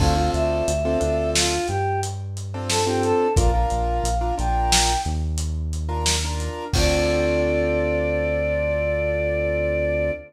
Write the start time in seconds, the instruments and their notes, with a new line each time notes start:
0.00 synth bass 1 D2, acoustic grand piano C4 D4 F4 A4, choir aahs F5, kick, crash
0.17 acoustic grand piano C4 D4 F4 A4
0.33 synth bass 1 D2, choir aahs E5, closed hi-hat
0.68 synth bass 1 D2, closed hi-hat
0.85 acoustic grand piano C4 D4 F4 A4
1.00 synth bass 1 D2, acoustic grand piano C4 D4 F4 A4, closed hi-hat
1.35 choir aahs F4, snare
1.68 synth bass 1 G2, choir aahs G4, closed hi-hat
2.03 closed hi-hat
2.37 closed hi-hat
2.54 acoustic grand piano C4 D4 F4 A4
2.69 choir aahs A4, snare
2.86 acoustic grand piano C4 D4 F4 A4, choir aahs G4
3.03 choir aahs A4, closed hi-hat
3.36 synth bass 1 A#1, acoustic grand piano D4 F4 A#4, choir aahs F5, kick, closed hi-hat
3.54 acoustic grand piano D4 F4 A#4
3.70 synth bass 1 A#1, closed hi-hat
4.04 synth bass 1 A#1, closed hi-hat
4.21 acoustic grand piano D4 F4 A#4
4.38 synth bass 1 A#1, acoustic grand piano D4 F4 A#4, choir aahs G5, closed hi-hat
4.72 snare
5.05 synth bass 1 D#2, closed hi-hat
5.38 closed hi-hat
5.73 closed hi-hat
5.89 acoustic grand piano D4 F4 A#4
6.06 snare
6.24 acoustic grand piano D4 F4 A#4
6.40 closed hi-hat
6.73 synth bass 1 D2, acoustic grand piano C4 D4 F4 A4, choir aahs D5, kick, crash